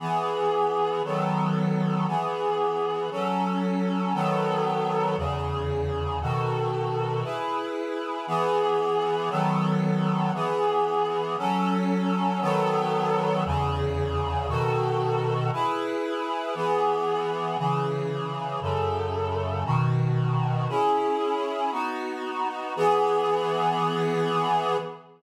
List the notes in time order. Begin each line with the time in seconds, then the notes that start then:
0.00 E3 B3 G#4
1.05 D#3 F#3 B3 A4
2.07 E3 B3 G#4
3.11 F#3 C#4 A4
4.14 D#3 F#3 B3 A4
5.17 E2 C#3 G#4
6.21 B2 D#3 F#4 A4
7.24 E4 G#4 B4
8.27 E3 B3 G#4
9.30 D#3 F#3 B3 A4
10.34 E3 B3 G#4
11.38 F#3 C#4 A4
12.41 D#3 F#3 B3 A4
13.45 E2 C#3 G#4
14.48 B2 D#3 F#4 A4
15.53 E4 G#4 B4
16.55 E3 B3 G#4
17.58 C#3 E3 G#4
18.62 F#2 C#3 A4
19.65 B2 D#3 F#4
20.69 C#4 E4 G#4
21.72 B3 D#4 F#4
22.76 E3 B3 G#4